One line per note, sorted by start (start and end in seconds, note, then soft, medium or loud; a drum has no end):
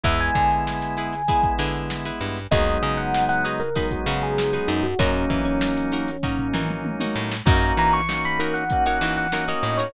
0.03 0.31 E2 loud
0.03 1.15 G#3 medium
0.03 1.15 B3 medium
0.03 1.15 E4 medium
0.03 0.54 E4 loud
0.03 0.54 G#4 medium
0.03 0.54 B4 medium
0.03 0.19 E5 medium
0.03 kick loud
0.03 closed hi-hat loud
0.20 1.54 G#5 medium
0.20 snare soft
0.20 closed hi-hat medium
0.35 1.40 D3 loud
0.35 kick medium
0.35 closed hi-hat medium
0.51 closed hi-hat medium
0.67 snare medium
0.81 snare medium
0.81 closed hi-hat medium
0.97 1.22 E4 medium
0.97 1.22 G#4 medium
0.97 1.22 B4 medium
0.97 closed hi-hat medium
1.13 snare soft
1.13 closed hi-hat medium
1.28 2.39 G#3 medium
1.28 2.39 B3 medium
1.28 2.39 E4 medium
1.28 1.53 E4 medium
1.28 1.53 G#4 medium
1.28 1.53 B4 medium
1.28 kick medium
1.28 closed hi-hat loud
1.43 kick medium
1.43 closed hi-hat medium
1.58 2.11 D3 medium
1.58 1.96 E4 medium
1.58 1.96 G#4 medium
1.58 1.96 B4 medium
1.58 closed hi-hat medium
1.75 closed hi-hat medium
1.90 snare loud
2.05 2.43 E4 medium
2.05 2.43 G#4 medium
2.05 2.43 B4 medium
2.05 snare soft
2.05 closed hi-hat medium
2.21 2.47 G2 medium
2.21 closed hi-hat medium
2.36 closed hi-hat medium
2.51 2.78 D#2 loud
2.51 3.62 F#3 medium
2.51 3.62 G#3 medium
2.51 3.62 B3 medium
2.51 3.62 D#4 loud
2.51 3.01 D#4 loud
2.51 3.01 F#4 loud
2.51 3.01 G#4 loud
2.51 3.01 B4 medium
2.51 2.77 D#5 loud
2.51 kick loud
2.51 closed hi-hat medium
2.68 closed hi-hat medium
2.82 3.88 C#3 medium
2.82 2.97 D#5 medium
2.82 snare soft
2.82 closed hi-hat medium
2.97 3.24 F#5 medium
2.97 snare soft
2.97 closed hi-hat medium
3.14 snare loud
3.29 3.44 F#5 medium
3.29 snare medium
3.29 closed hi-hat medium
3.44 3.70 D#4 medium
3.44 3.70 F#4 medium
3.44 3.70 G#4 medium
3.44 3.70 B4 medium
3.44 3.59 D#5 medium
3.44 closed hi-hat medium
3.60 3.87 A#4 medium
3.60 closed hi-hat medium
3.75 4.87 F#3 medium
3.75 4.87 G#3 medium
3.75 4.87 B3 medium
3.75 4.00 D#4 medium
3.75 4.87 D#4 medium
3.75 4.00 F#4 medium
3.75 4.00 G#4 medium
3.75 4.00 B4 medium
3.75 kick medium
3.75 closed hi-hat loud
3.91 4.21 F#4 medium
3.91 kick medium
3.91 closed hi-hat medium
4.06 4.59 C#3 loud
4.06 4.44 D#4 medium
4.06 4.44 F#4 medium
4.06 4.44 G#4 medium
4.06 4.44 B4 medium
4.06 closed hi-hat medium
4.21 4.52 G#4 medium
4.21 snare soft
4.21 closed hi-hat medium
4.38 snare loud
4.53 4.90 D#4 medium
4.53 4.90 F#4 medium
4.53 4.68 G#4 medium
4.53 4.90 G#4 medium
4.53 4.90 B4 medium
4.53 closed hi-hat medium
4.68 4.94 F#2 loud
4.68 4.83 D#4 medium
4.68 closed hi-hat medium
4.83 4.98 F#4 medium
4.83 closed hi-hat medium
4.99 5.25 F#2 loud
4.99 6.10 F#3 loud
4.99 6.10 A#3 loud
4.99 5.49 C#4 medium
4.99 6.10 C#4 loud
4.99 5.39 C#4 loud
4.99 6.10 D#4 medium
4.99 5.49 D#4 loud
4.99 5.49 F#4 medium
4.99 5.49 A#4 loud
4.99 kick loud
4.99 closed hi-hat loud
5.14 closed hi-hat medium
5.30 6.35 E3 medium
5.30 kick medium
5.30 snare soft
5.30 closed hi-hat medium
5.45 6.61 C#4 medium
5.45 closed hi-hat medium
5.61 snare loud
5.76 snare medium
5.76 closed hi-hat medium
5.92 6.17 C#4 medium
5.92 6.17 D#4 medium
5.92 6.17 F#4 medium
5.92 6.17 A#4 medium
5.92 closed hi-hat medium
6.08 closed hi-hat medium
6.23 7.35 F#3 medium
6.23 7.35 A#3 medium
6.23 6.48 C#4 medium
6.23 7.35 C#4 medium
6.23 6.48 D#4 medium
6.23 7.35 D#4 medium
6.23 6.48 F#4 medium
6.23 6.48 A#4 medium
6.23 kick medium
6.23 floor tom medium
6.39 floor tom medium
6.53 7.06 E3 medium
6.53 6.91 C#4 medium
6.53 6.91 D#4 medium
6.53 6.91 F#4 medium
6.53 6.91 A#4 medium
6.53 mid tom medium
6.70 mid tom medium
6.85 high tom medium
7.00 7.38 C#4 medium
7.00 7.38 D#4 medium
7.00 7.38 F#4 medium
7.00 7.38 A#4 medium
7.00 high tom medium
7.16 7.42 A2 medium
7.31 snare loud
7.45 7.73 F#2 loud
7.45 8.01 A#3 medium
7.45 8.01 C#4 medium
7.45 8.01 D#4 medium
7.45 7.96 D#4 loud
7.45 8.01 F#4 loud
7.45 7.96 F#4 loud
7.45 7.96 A#4 loud
7.45 7.96 C#5 loud
7.45 7.72 A#5 medium
7.45 kick loud
7.45 crash medium
7.62 closed hi-hat medium
7.77 8.82 E3 loud
7.77 7.93 A#5 medium
7.77 snare soft
7.77 closed hi-hat medium
7.93 8.22 C#6 loud
7.93 closed hi-hat medium
8.09 8.64 A#3 medium
8.09 8.64 C#4 medium
8.09 8.64 D#4 medium
8.09 8.64 F#4 medium
8.09 snare loud
8.24 8.40 B5 medium
8.24 snare medium
8.24 closed hi-hat medium
8.39 8.77 D#4 medium
8.39 8.77 F#4 medium
8.39 8.54 A#4 medium
8.39 8.77 A#4 medium
8.39 8.77 C#5 medium
8.39 closed hi-hat medium
8.54 8.84 F#5 medium
8.54 closed hi-hat medium
8.70 9.27 A#3 medium
8.70 9.27 C#4 medium
8.70 9.27 D#4 medium
8.70 9.27 F#4 medium
8.70 kick medium
8.70 closed hi-hat loud
8.86 8.98 D#4 medium
8.86 8.98 F#4 medium
8.86 8.98 A#4 medium
8.86 8.98 C#5 medium
8.86 9.13 F#5 medium
8.86 closed hi-hat medium
9.01 9.54 E3 medium
9.01 9.26 D#4 medium
9.01 9.26 F#4 medium
9.01 9.26 A#4 medium
9.01 9.26 C#5 medium
9.01 snare soft
9.01 closed hi-hat medium
9.17 9.46 F#5 medium
9.17 closed hi-hat medium
9.32 9.89 A#3 medium
9.32 9.89 C#4 medium
9.32 9.45 D#4 medium
9.32 9.89 D#4 medium
9.32 9.45 F#4 medium
9.32 9.89 F#4 medium
9.32 9.45 A#4 medium
9.32 9.45 C#5 medium
9.32 snare loud
9.48 9.73 D#4 medium
9.48 9.73 F#4 medium
9.48 9.73 A#4 medium
9.48 9.73 C#5 medium
9.48 9.63 D#5 medium
9.48 closed hi-hat medium
9.63 9.89 A2 medium
9.63 9.78 D#5 medium
9.63 closed hi-hat medium
9.78 9.91 D#4 medium
9.78 9.91 F#4 medium
9.78 9.91 A#4 medium
9.78 9.92 C#5 medium
9.78 9.91 C#5 medium
9.78 snare soft
9.78 closed hi-hat medium